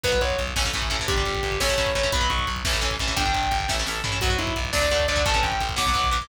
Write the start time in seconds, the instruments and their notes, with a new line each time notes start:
0.03 electric bass (finger) B1, overdriven guitar F#3 B3, distortion guitar B4, kick, crash
0.12 overdriven guitar F#3 B3, kick
0.21 electric bass (finger) B1, distortion guitar C#5, kick, closed hi-hat
0.30 kick
0.38 electric bass (finger) B1, kick, closed hi-hat
0.47 kick
0.56 electric bass (finger) A1, overdriven guitar E3 A3 C#4, kick, snare
0.65 overdriven guitar E3 A3 C#4, kick
0.73 electric bass (finger) A1, overdriven guitar E3 A3 C#4, kick, closed hi-hat
0.82 kick
0.90 electric bass (finger) A1, overdriven guitar E3 A3 C#4, kick, closed hi-hat
0.99 overdriven guitar E3 A3 C#4, kick
1.08 electric bass (finger) G1, overdriven guitar G3 D4, distortion guitar G4, kick, closed hi-hat
1.17 overdriven guitar G3 D4, kick
1.26 electric bass (finger) G1, kick, closed hi-hat
1.34 kick
1.43 electric bass (finger) G1, kick, closed hi-hat
1.52 kick
1.60 electric bass (finger) A1, overdriven guitar A3 C#4 E4, distortion guitar C#5, kick, snare
1.69 overdriven guitar A3 C#4 E4, kick
1.78 electric bass (finger) A1, overdriven guitar A3 C#4 E4, kick, closed hi-hat
1.87 kick
1.95 electric bass (finger) A1, overdriven guitar A3 C#4 E4, distortion guitar C#5, kick, closed hi-hat
2.03 overdriven guitar A3 C#4 E4, kick
2.12 electric bass (finger) B1, overdriven guitar F#3 B3, distortion guitar B5, kick, closed hi-hat
2.21 overdriven guitar F#3 B3, kick
2.30 electric bass (finger) B1, distortion guitar C#6, kick, closed hi-hat
2.39 kick
2.47 electric bass (finger) B1, kick, closed hi-hat
2.56 kick
2.65 electric bass (finger) A1, overdriven guitar E3 A3 C#4, kick, snare
2.73 overdriven guitar E3 A3 C#4, kick
2.81 electric bass (finger) A1, overdriven guitar E3 A3 C#4, kick, closed hi-hat
2.91 kick
2.99 electric bass (finger) A1, overdriven guitar E3 A3 C#4, kick, closed hi-hat
3.08 overdriven guitar E3 A3 C#4, kick
3.16 electric bass (finger) G1, overdriven guitar G3 D4, distortion guitar G5, kick, closed hi-hat
3.25 overdriven guitar G3 D4, kick
3.34 electric bass (finger) G1, kick, closed hi-hat
3.43 kick
3.51 electric bass (finger) G1, kick, closed hi-hat
3.60 kick
3.68 electric bass (finger) A1, overdriven guitar A3 C#4 E4, kick, snare
3.79 overdriven guitar A3 C#4 E4
3.86 electric bass (finger) A1, overdriven guitar A3 C#4 E4, snare
4.04 electric bass (finger) A1, overdriven guitar A3 C#4 E4, floor tom
4.12 overdriven guitar A3 C#4 E4
4.21 electric bass (finger) B1, overdriven guitar F#3 B3, distortion guitar F#4, kick, crash
4.30 overdriven guitar F#3 B3, kick
4.38 electric bass (finger) B1, distortion guitar E4, kick, closed hi-hat
4.47 kick
4.56 electric bass (finger) B1, kick, closed hi-hat
4.65 kick
4.73 electric bass (finger) D2, overdriven guitar F#3 A3 D4, distortion guitar D5, kick, snare
4.81 overdriven guitar F#3 A3 D4, kick
4.91 electric bass (finger) D2, overdriven guitar F#3 A3 D4, kick, closed hi-hat
5.00 kick
5.08 electric bass (finger) D2, overdriven guitar F#3 A3 D4, distortion guitar D5, kick, closed hi-hat
5.16 overdriven guitar F#3 A3 D4, kick
5.25 electric bass (finger) A1, overdriven guitar E3 A3 C#4, distortion guitar A5, kick, closed hi-hat
5.34 overdriven guitar E3 A3 C#4, kick
5.43 electric bass (finger) A1, distortion guitar G5, kick, closed hi-hat
5.52 kick
5.60 electric bass (finger) A1, kick, closed hi-hat
5.69 kick
5.76 electric bass (finger) B1, overdriven guitar F#3 B3, distortion guitar D6, kick, snare
5.86 overdriven guitar F#3 B3, kick
5.94 electric bass (finger) B1, overdriven guitar F#3 B3, kick, closed hi-hat
6.04 kick
6.11 electric bass (finger) B1, overdriven guitar F#3 B3, distortion guitar D6, kick, closed hi-hat
6.21 overdriven guitar F#3 B3, kick